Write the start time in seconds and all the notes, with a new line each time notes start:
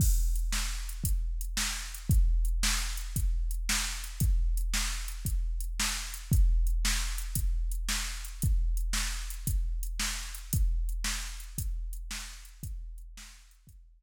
0.00 kick, crash
0.36 closed hi-hat
0.52 snare
0.89 closed hi-hat
1.04 kick, closed hi-hat
1.41 closed hi-hat
1.57 snare
1.94 closed hi-hat
2.10 kick, closed hi-hat
2.45 closed hi-hat
2.63 snare
2.97 closed hi-hat
3.16 kick, closed hi-hat
3.51 closed hi-hat
3.69 snare
4.04 closed hi-hat
4.20 kick, closed hi-hat
4.57 closed hi-hat
4.74 snare
5.08 closed hi-hat
5.25 kick, closed hi-hat
5.60 closed hi-hat
5.80 snare
6.14 closed hi-hat
6.32 kick, closed hi-hat
6.67 closed hi-hat
6.85 snare
7.18 closed hi-hat
7.35 kick, closed hi-hat
7.71 closed hi-hat
7.89 snare
8.25 closed hi-hat
8.42 kick, closed hi-hat
8.77 closed hi-hat
8.93 snare
9.30 closed hi-hat
9.47 kick, closed hi-hat
9.83 closed hi-hat
9.99 snare
10.35 closed hi-hat
10.53 kick, closed hi-hat
10.89 closed hi-hat
11.04 snare
11.40 closed hi-hat
11.58 kick, closed hi-hat
11.93 closed hi-hat
12.11 snare
12.45 closed hi-hat
12.63 kick, closed hi-hat
12.98 closed hi-hat
13.17 snare
13.51 closed hi-hat
13.67 kick, closed hi-hat